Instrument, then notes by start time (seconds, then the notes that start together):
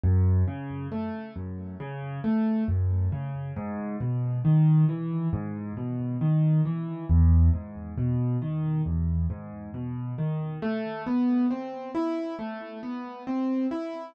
acoustic grand piano
0.03 F#2
0.48 C#3
0.92 A3
1.36 F#2
1.80 C#3
2.24 A3
2.68 F#2
3.12 C#3
3.56 G#2
4.01 B2
4.45 D#3
4.89 E3
5.33 G#2
5.77 B2
6.21 D#3
6.65 E3
7.09 E2
7.53 G#2
7.98 B2
8.42 D#3
8.86 E2
9.30 G#2
9.74 B2
10.18 D#3
10.62 A3
11.06 B3
11.51 C4
11.95 E4
12.39 A3
12.83 B3
13.27 C4
13.71 E4